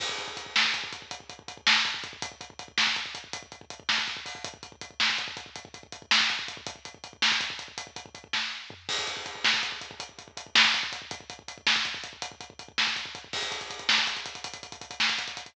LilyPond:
\new DrumStaff \drummode { \time 12/8 \tempo 4. = 108 <cymc bd>16 bd16 <hh bd>16 bd16 <hh bd>16 bd16 <bd sn>16 bd16 <hh bd>16 bd16 <hh bd>16 bd16 <hh bd>16 bd16 <hh bd>16 bd16 <hh bd>16 bd16 <bd sn>16 bd16 <hh bd>16 bd16 <hh bd>16 bd16 | <hh bd>16 bd16 <hh bd>16 bd16 <hh bd>16 bd16 <bd sn>16 bd16 <hh bd>16 bd16 <hh bd>16 bd16 <hh bd>16 bd16 <hh bd>16 bd16 <hh bd>16 bd16 <bd sn>16 bd16 <hh bd>16 bd16 <hho bd>16 bd16 | <hh bd>16 bd16 <hh bd>16 bd16 <hh bd>16 bd16 <bd sn>16 bd16 <hh bd>16 bd16 <hh bd>16 bd16 <hh bd>16 bd16 <hh bd>16 bd16 <hh bd>16 bd16 <bd sn>16 bd16 <hh bd>16 bd16 <hh bd>16 bd16 | <hh bd>16 bd16 <hh bd>16 bd16 <hh bd>16 bd16 <bd sn>16 bd16 <hh bd>16 bd16 <hh bd>16 bd16 <hh bd>16 bd16 <hh bd>16 bd16 <hh bd>16 bd16 <bd sn>4 tomfh8 |
<cymc bd>16 bd16 <hh bd>16 bd16 <hh bd>16 bd16 <bd sn>16 bd16 <hh bd>16 bd16 <hh bd>16 bd16 <hh bd>16 bd16 <hh bd>16 bd16 <hh bd>16 bd16 <bd sn>16 bd16 <hh bd>16 bd16 <hh bd>16 bd16 | <hh bd>16 bd16 <hh bd>16 bd16 <hh bd>16 bd16 <bd sn>16 bd16 <hh bd>16 bd16 <hh bd>16 bd16 <hh bd>16 bd16 <hh bd>16 bd16 <hh bd>16 bd16 <bd sn>16 bd16 <hh bd>16 bd16 <hh bd>16 bd16 | <cymc bd>16 <hh bd>16 <hh bd>16 <hh bd>16 <hh bd>16 <hh bd>16 <bd sn>16 <hh bd>16 <hh bd>16 <hh bd>16 <hh bd>16 <hh bd>16 <hh bd>16 <hh bd>16 <hh bd>16 <hh bd>16 <hh bd>16 <hh bd>16 <bd sn>16 <hh bd>16 <hh bd>16 <hh bd>16 <hh bd>16 <hh bd>16 | }